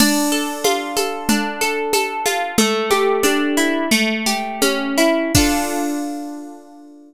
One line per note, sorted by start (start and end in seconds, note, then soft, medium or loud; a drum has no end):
0.00 1.29 D4 loud
0.00 crash loud
0.00 low conga loud
0.00 shaker loud
0.32 0.96 A4 medium
0.64 2.25 F4 medium
0.64 high conga loud
0.64 shaker medium
0.97 1.61 A4 medium
0.97 high conga medium
0.97 shaker medium
1.29 2.52 D4 loud
1.29 low conga loud
1.29 shaker medium
1.61 1.93 A4 medium
1.61 shaker medium
1.93 2.55 A4 medium
1.93 high conga loud
1.93 shaker loud
2.26 2.56 F4 medium
2.26 high conga medium
2.26 shaker medium
2.58 3.85 A3 loud
2.58 low conga loud
2.58 shaker loud
2.91 3.86 G4 medium
2.91 high conga loud
2.91 shaker medium
3.23 3.88 D4 medium
3.23 high conga loud
3.23 shaker medium
3.57 3.90 E4 loud
3.57 shaker medium
3.91 5.27 A3 loud
3.91 low conga medium
3.91 shaker medium
4.26 5.29 G4 loud
4.26 low conga medium
4.26 shaker medium
4.62 5.31 C#4 loud
4.62 high conga loud
4.62 shaker medium
4.98 5.32 E4 medium
4.98 shaker medium
5.35 7.14 D4 loud
5.35 7.14 F4 loud
5.35 7.14 A4 loud
5.35 kick loud
5.35 crash loud